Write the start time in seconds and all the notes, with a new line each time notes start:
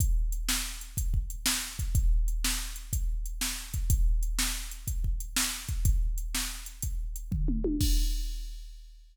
0.00 kick, closed hi-hat
0.32 closed hi-hat
0.49 snare
0.81 closed hi-hat
0.97 kick, closed hi-hat
1.14 kick
1.30 closed hi-hat
1.46 snare
1.79 kick, closed hi-hat
1.95 kick, closed hi-hat
2.28 closed hi-hat
2.44 snare
2.76 closed hi-hat
2.93 kick, closed hi-hat
3.26 closed hi-hat
3.41 snare
3.74 kick, closed hi-hat
3.90 kick, closed hi-hat
4.23 closed hi-hat
4.39 snare
4.71 closed hi-hat
4.88 kick, closed hi-hat
5.04 kick
5.20 closed hi-hat
5.36 snare
5.68 kick, closed hi-hat
5.85 kick, closed hi-hat
6.18 closed hi-hat
6.35 snare
6.66 closed hi-hat
6.82 kick, closed hi-hat
7.16 closed hi-hat
7.32 kick, floor tom
7.48 mid tom
7.64 high tom
7.81 kick, crash